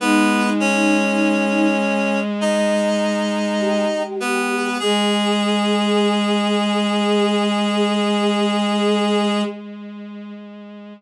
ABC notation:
X:1
M:4/4
L:1/8
Q:1/4=50
K:G#m
V:1 name="Clarinet"
[B,B] [Cc]3 [Dd]3 [B,B] | G8 |]
V:2 name="Choir Aahs"
D3 z3 =G2 | G8 |]
V:3 name="Violin" clef=bass
G,8 | G,8 |]